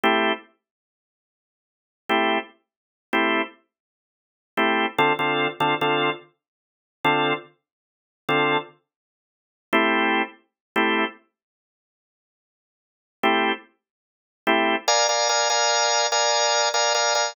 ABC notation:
X:1
M:12/8
L:1/8
Q:3/8=97
K:Am
V:1 name="Drawbar Organ"
[A,CEG]10 [A,CEG]2- | [A,CEG]3 [A,CEG]7 [A,CEG]2 | [D,CFA] [D,CFA]2 [D,CFA] [D,CFA]6 [D,CFA]2- | [D,CFA]4 [D,CFA]7 [A,CEG]- |
[A,CEG]4 [A,CEG]8- | [A,CEG]4 [A,CEG]6 [A,CEG]2 | [K:Dm] [Bdf_a] [Bdfa] [Bdfa] [Bdfa]3 [Bdfa]3 [Bdfa] [Bdfa] [Bdfa] |]